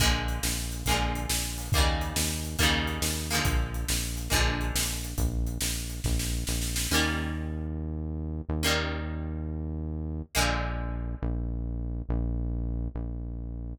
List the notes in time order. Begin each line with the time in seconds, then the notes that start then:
0.00 A#1 D3 F3 G#3 A#3, kick, closed hi-hat
0.28 closed hi-hat
0.43 A#1, snare
0.72 closed hi-hat
0.86 A#1 G#3 A#3, kick, closed hi-hat
0.90 D3 F3
1.15 closed hi-hat
1.29 A#1, snare
1.58 open hi-hat
1.72 D#2 G3 A#3, kick, closed hi-hat
1.76 C#3 D#3
2.01 closed hi-hat
2.16 D#2, snare
2.45 closed hi-hat
2.59 D#2 D#3 G3 A#3, kick, closed hi-hat
2.63 C#3
2.87 closed hi-hat
3.02 D#2, snare
3.30 F3 G#3 A#3, closed hi-hat
3.34 D3
3.45 A#1, kick, closed hi-hat
3.74 closed hi-hat
3.88 A#1, snare
4.17 closed hi-hat
4.30 A#1 D3 F3 G#3 A#3, kick, closed hi-hat
4.61 closed hi-hat
4.75 A#1, snare
5.04 closed hi-hat
5.18 A#1, kick, closed hi-hat
5.47 closed hi-hat
5.61 A#1, snare
5.90 closed hi-hat
6.04 A#1, kick, snare
6.19 snare
6.47 A#1, snare
6.62 snare
6.76 snare
6.91 D#2 G3 A#3 C#4
6.95 D#3
8.49 D#2
8.63 D#3 G3 A#3 C#4
10.35 A#1 D3 F3 G#3 A#3
11.22 A#1
12.09 A#1
12.95 A#1